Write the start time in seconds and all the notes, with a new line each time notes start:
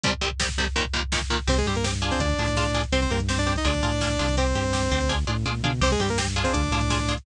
0.03 C2 C3 G3, kick, closed hi-hat
0.12 kick
0.21 C2 C3 G3, kick
0.31 kick
0.40 C2 C3 G3, kick, snare
0.49 kick
0.58 C2 C3 G3, kick
0.66 kick
0.76 D#2 A#2 D#3, kick, closed hi-hat
0.85 kick
0.93 D#2 A#2 D#3, kick
1.03 kick
1.12 D#2 A#2 D#3, kick, snare
1.21 kick
1.30 D#2 A#2 D#3, kick
1.39 kick
1.47 C2 C4 G4 C5, kick, crash
1.57 G#3 G#4, kick, closed hi-hat
1.66 G2 G3 C4 G4, kick, closed hi-hat
1.75 A#3 A#4, kick, closed hi-hat
1.84 C4 G4, kick, snare
1.93 kick, closed hi-hat
2.02 D4 F4 G#4, kick, closed hi-hat
2.11 C4 C5, kick, closed hi-hat
2.19 D2 D4 D5, kick, closed hi-hat
2.29 kick, closed hi-hat
2.38 A2 D4 F4 G#4, kick, closed hi-hat
2.48 kick, closed hi-hat
2.56 D4 F4 G#4, kick, snare
2.65 kick, closed hi-hat
2.74 D4 F4 G#4, kick, snare, closed hi-hat
2.84 kick, closed hi-hat
2.92 C2 C4 G4 C5, kick, closed hi-hat
3.02 C4 C5, kick, closed hi-hat
3.10 G2 A#3 C4 G4 A#4, kick, closed hi-hat
3.20 kick, closed hi-hat
3.28 C4 G4 C5, kick, snare
3.38 D4 D5, kick, closed hi-hat
3.47 C4 G4, kick, closed hi-hat
3.56 D#4 D#5, kick, closed hi-hat
3.65 D2 D4 F4 G#4 D5, kick, closed hi-hat
3.74 kick, closed hi-hat
3.82 A2 D4 F4 G#4, kick, closed hi-hat
3.92 kick, closed hi-hat
4.01 D4 F4 G#4, kick, snare
4.10 kick, closed hi-hat
4.19 C2 D4 F4 G#4, kick, snare, closed hi-hat
4.28 kick, closed hi-hat
4.37 C4 G4 C5, kick, closed hi-hat
4.46 kick, closed hi-hat
4.55 G2 C4 G4, kick, closed hi-hat
4.64 kick, closed hi-hat
4.73 C4 G4, kick, snare
4.82 kick, closed hi-hat
4.91 D2 C4 G4, kick, closed hi-hat
5.01 kick, closed hi-hat
5.09 D4 F4 G#4, kick, snare
5.27 A2 D4 F4 G#4, high tom
5.46 A#2 D4 F4 G#4, mid tom
5.63 B2 D4 F4 G#4, floor tom
5.81 C2 C4 G4 C5, kick, crash
5.91 G#3 G#4, kick, closed hi-hat
6.00 G2 G3 C4 G4, kick, closed hi-hat
6.09 A#3 A#4, kick, closed hi-hat
6.18 C4 G4, kick, snare
6.27 kick, closed hi-hat
6.36 D4 F4 G#4, kick, closed hi-hat
6.44 C4 C5, kick, closed hi-hat
6.53 D2 D4 D5, kick, closed hi-hat
6.63 kick, closed hi-hat
6.71 A2 D4 F4 G#4, kick, closed hi-hat
6.81 kick, closed hi-hat
6.90 D4 F4 G#4, kick, snare
6.99 kick, closed hi-hat
7.08 D4 F4 G#4, kick, snare, closed hi-hat
7.17 kick, closed hi-hat